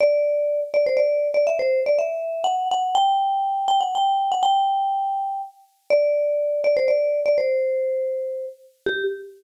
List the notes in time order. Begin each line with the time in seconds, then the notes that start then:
0.01 D5
0.74 D5
0.86 C5
0.97 D5
1.34 D5
1.47 E5
1.59 C5
1.86 D5
1.99 E5
2.44 F#5
2.71 F#5
2.95 G5
3.68 G5
3.81 F#5
3.95 G5
4.32 F#5
4.43 G5
5.90 D5
6.64 D5
6.77 C5
6.88 D5
7.26 D5
7.38 C5
8.86 G4